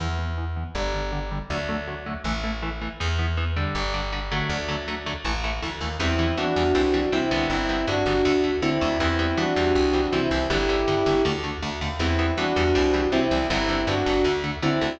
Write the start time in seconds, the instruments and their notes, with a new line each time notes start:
0.00 electric bass (finger) E2, overdriven guitar E3 B3
0.19 overdriven guitar E3 B3
0.38 overdriven guitar E3 B3
0.56 overdriven guitar E3 B3
0.75 electric bass (finger) G1, overdriven guitar D3 G3
0.94 overdriven guitar D3 G3
1.12 overdriven guitar D3 G3
1.31 overdriven guitar D3 G3
1.50 electric bass (finger) D2, overdriven guitar D3 F#3 A3
1.69 overdriven guitar D3 F#3 A3
1.88 overdriven guitar D3 F#3 A3
2.06 overdriven guitar D3 F#3 A3
2.24 electric bass (finger) A1, overdriven guitar E3 A3
2.44 overdriven guitar E3 A3
2.62 overdriven guitar E3 A3
2.81 overdriven guitar E3 A3
3.00 electric bass (finger) E2, overdriven guitar E3 B3
3.19 overdriven guitar E3 B3
3.37 overdriven guitar E3 B3
3.56 overdriven guitar D3 G3
3.75 electric bass (finger) G1
3.94 overdriven guitar D3 G3
4.12 overdriven guitar D3 G3
4.31 overdriven guitar D3 F#3 A3
4.49 electric bass (finger) D2
4.69 overdriven guitar D3 F#3 A3
4.88 overdriven guitar D3 F#3 A3
5.06 overdriven guitar D3 F#3 A3
5.25 electric bass (finger) A1, overdriven guitar E3 A3
5.44 overdriven guitar E3 A3
5.62 electric bass (finger) D2, overdriven guitar E3 A3
5.81 electric bass (finger) D#2, overdriven guitar E3 A3
5.99 electric bass (finger) E2, overdriven guitar E3 G3 B3, distortion guitar C4 E4
6.19 overdriven guitar E3 G3 B3
6.37 overdriven guitar E3 G3 B3, electric bass (finger) E3, distortion guitar D4 F#4
6.56 electric bass (finger) E2, overdriven guitar E3 G3 B3
6.75 electric bass (finger) C2, overdriven guitar E3 G3 C4
6.94 overdriven guitar E3 G3 C4
7.12 electric bass (finger) C3, overdriven guitar E3 G3 C4, distortion guitar C4 E4
7.31 electric bass (finger) C2, overdriven guitar D3 G3 B3
7.50 electric bass (finger) G1, distortion guitar C4 E4
7.69 overdriven guitar D3 G3 B3
7.87 electric bass (finger) G2, overdriven guitar D3 G3 B3, distortion guitar D4 F#4
8.06 electric bass (finger) G1, overdriven guitar D3 G3 B3
8.25 electric bass (finger) D2, overdriven guitar D3 A3
8.44 overdriven guitar D3 A3
8.62 electric bass (finger) D3, overdriven guitar D3 A3, distortion guitar C4 E4
8.81 electric bass (finger) D2, overdriven guitar D3 A3
9.00 electric bass (finger) E2, overdriven guitar E3 G3 B3, distortion guitar C4 E4
9.19 overdriven guitar E3 G3 B3
9.37 overdriven guitar E3 G3 B3, electric bass (finger) E3, distortion guitar D4 F#4
9.56 electric bass (finger) E2, overdriven guitar E3 G3 C4
9.75 electric bass (finger) C2
9.94 overdriven guitar E3 G3 C4
10.12 electric bass (finger) C3, overdriven guitar E3 G3 C4, distortion guitar C4 E4
10.31 electric bass (finger) C2, overdriven guitar E3 G3 C4
10.50 electric bass (finger) G1, overdriven guitar D3 G3 B3, distortion guitar E4 G4
10.69 overdriven guitar D3 G3 B3
10.88 electric bass (finger) G2, overdriven guitar D3 G3 B3
11.06 electric bass (finger) G1, overdriven guitar D3 G3 B3
11.25 electric bass (finger) D2, overdriven guitar D3 A3
11.44 overdriven guitar D3 A3
11.62 electric bass (finger) D2, overdriven guitar D3 A3
11.81 electric bass (finger) D#2, overdriven guitar D3 A3
11.99 electric bass (finger) E2, overdriven guitar E3 G3 B3, distortion guitar C4 E4
12.19 overdriven guitar E3 G3 B3
12.37 electric bass (finger) E3, overdriven guitar E3 G3 B3, distortion guitar D4 F#4
12.56 electric bass (finger) E2, overdriven guitar E3 G3 B3
12.75 electric bass (finger) C2, overdriven guitar E3 G3 C4
12.94 overdriven guitar E3 G3 C4
13.12 electric bass (finger) C3, overdriven guitar E3 G3 C4, distortion guitar C4 E4
13.31 electric bass (finger) C2, overdriven guitar E3 G3 C4
13.50 electric bass (finger) G1, overdriven guitar D3 G3 B3, distortion guitar C4 E4
13.69 overdriven guitar D3 G3 B3
13.87 electric bass (finger) G2, overdriven guitar D3 G3 B3, distortion guitar D4 F#4
14.06 electric bass (finger) G1, overdriven guitar D3 G3 B3
14.24 electric bass (finger) D2, overdriven guitar D3 A3
14.44 overdriven guitar D3 A3
14.62 overdriven guitar D3 A3, electric bass (finger) D3, distortion guitar C4 E4
14.81 electric bass (finger) D2, overdriven guitar D3 A3